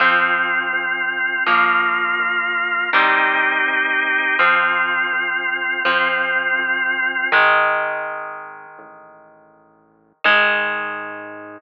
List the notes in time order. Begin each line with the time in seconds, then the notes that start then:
0.00 F2 F3 C4 F4
0.73 F2
1.46 A#1 F3 A#3 F4
2.19 A#1
2.93 C2 D#3 G3 C4 D#4 G4
3.66 C2
4.39 F2 F3 C4 F4
5.13 F2
5.85 F2 F3 C4 F4
6.59 F2
7.32 G#1 D#3 G#3
8.78 A1
10.24 G#2 D#3 G#3